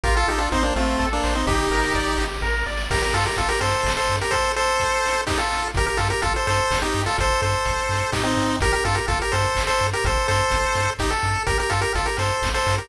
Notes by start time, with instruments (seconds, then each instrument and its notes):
0.03 synth bass 1 A1, lead 1 (square) F4 G4 A#4, kick, closed hi-hat
0.17 lead 1 (square) F4 A4
0.28 synth bass 1 A1, lead 1 (square) D#4 G4 A4, open hi-hat
0.38 lead 1 (square) D4 F4
0.52 synth bass 1 A1, lead 1 (square) C4 D#4 C5, kick, closed hi-hat
0.63 lead 1 (square) A#3 D4
0.75 synth bass 1 A1, lead 1 (square) A3 C4 F4, open hi-hat
0.99 synth bass 1 A1, lead 1 (square) A4, kick, snare
1.13 lead 1 (square) A#3 D4
1.24 synth bass 1 A1, lead 1 (square) C5, snare
1.35 lead 1 (square) C4 D#4
1.46 synth bass 1 G1, lead 1 (square) D#4 G4, kick, crash
1.71 synth bass 1 G1, lead 1 (square) A#4, open hi-hat
1.94 synth bass 1 G1, lead 1 (square) D5, kick, closed hi-hat
2.18 synth bass 1 G1, lead 1 (square) G4, open hi-hat
2.41 synth bass 1 A1, lead 1 (square) A#4, kick, snare
2.66 synth bass 1 G#1, lead 1 (square) D5, snare
2.77 snare
2.90 synth bass 1 G1, lead 1 (square) G4 A#4, kick, crash
3.02 lead 1 (square) G4 A#4, closed hi-hat
3.13 synth bass 1 G2, lead 1 (square) F4 A4, open hi-hat
3.26 lead 1 (square) G4 A#4, closed hi-hat
3.36 synth bass 1 G1, lead 1 (square) F4 A4, kick, closed hi-hat
3.49 lead 1 (square) G4 A#4, closed hi-hat
3.61 synth bass 1 G2, lead 1 (square) A4 C5, open hi-hat
3.73 closed hi-hat
3.83 synth bass 1 G1, kick, snare
3.97 lead 1 (square) A4 C5, closed hi-hat
4.09 synth bass 1 G2, open hi-hat
4.20 lead 1 (square) G4 A#4, closed hi-hat
4.31 lead 1 (square) A4 C5, kick, closed hi-hat
4.44 closed hi-hat
4.56 lead 1 (square) A4 C5, open hi-hat
4.67 closed hi-hat
4.80 kick, closed hi-hat
4.93 closed hi-hat
5.05 open hi-hat
5.16 closed hi-hat
5.27 lead 1 (square) D#4 G4, kick, snare
5.38 lead 1 (square) F4 A4, closed hi-hat
5.51 open hi-hat
5.62 closed hi-hat
5.74 synth bass 1 G1, lead 1 (square) G4 A#4, kick, closed hi-hat
5.86 lead 1 (square) G4 A#4, closed hi-hat
5.97 synth bass 1 G2, lead 1 (square) F4 A4, open hi-hat
6.10 lead 1 (square) G4 A#4, closed hi-hat
6.22 synth bass 1 G1, lead 1 (square) F4 A4, kick, closed hi-hat
6.34 lead 1 (square) A4 C5, closed hi-hat
6.47 synth bass 1 G2, lead 1 (square) A4 C5, open hi-hat
6.59 closed hi-hat
6.71 synth bass 1 G1, kick, snare
6.82 lead 1 (square) D#4 G4, closed hi-hat
6.94 synth bass 1 G2, open hi-hat
7.06 lead 1 (square) F4 A4, open hi-hat
7.18 synth bass 1 G1, lead 1 (square) A4 C5, kick, closed hi-hat
7.30 closed hi-hat
7.41 synth bass 1 G2, lead 1 (square) A4 C5, open hi-hat
7.53 closed hi-hat
7.65 synth bass 1 G1, kick, closed hi-hat
7.78 closed hi-hat
7.89 synth bass 1 G2, open hi-hat
8.01 closed hi-hat
8.12 synth bass 1 A2, lead 1 (square) D#4 G4, kick, snare
8.23 lead 1 (square) C4 D#4, closed hi-hat
8.37 synth bass 1 G#2, open hi-hat
8.50 closed hi-hat
8.60 synth bass 1 G1, lead 1 (square) G4 A#4, kick, closed hi-hat
8.72 lead 1 (square) G4 A#4, closed hi-hat
8.84 synth bass 1 G2, lead 1 (square) F4 A4, open hi-hat
8.95 lead 1 (square) G4 A#4, closed hi-hat
9.08 synth bass 1 G1, lead 1 (square) F4 A4, kick, closed hi-hat
9.19 lead 1 (square) G4 A#4, closed hi-hat
9.32 synth bass 1 G2, lead 1 (square) A4 C5, open hi-hat
9.44 closed hi-hat
9.55 synth bass 1 G1, kick, clap
9.67 lead 1 (square) A4 C5, closed hi-hat
9.79 synth bass 1 G2, open hi-hat
9.93 lead 1 (square) G4 A#4, closed hi-hat
10.04 synth bass 1 G1, lead 1 (square) A4 C5, kick, closed hi-hat
10.17 closed hi-hat
10.28 synth bass 1 G2, lead 1 (square) A4 C5, open hi-hat
10.39 closed hi-hat
10.50 synth bass 1 G1, kick, closed hi-hat
10.65 closed hi-hat
10.75 synth bass 1 G2, open hi-hat
10.87 closed hi-hat
10.99 synth bass 1 G1, lead 1 (square) D#4 G4, kick, clap
11.10 lead 1 (square) A4, closed hi-hat
11.22 synth bass 1 G2, open hi-hat
11.36 closed hi-hat
11.46 synth bass 1 G1, lead 1 (square) G4 A#4, kick, closed hi-hat
11.58 lead 1 (square) G4 A#4, closed hi-hat
11.70 synth bass 1 G2, lead 1 (square) F4 A4, open hi-hat
11.81 lead 1 (square) G4 A#4, closed hi-hat
11.95 synth bass 1 G1, lead 1 (square) F4 A4, kick, closed hi-hat
12.06 lead 1 (square) G4 A#4, closed hi-hat
12.17 synth bass 1 G2, lead 1 (square) A4 C5, open hi-hat
12.29 closed hi-hat
12.42 synth bass 1 G1, kick, snare
12.54 lead 1 (square) A4 C5, closed hi-hat
12.66 synth bass 1 G2, open hi-hat
12.77 lead 1 (square) G4 A#4, closed hi-hat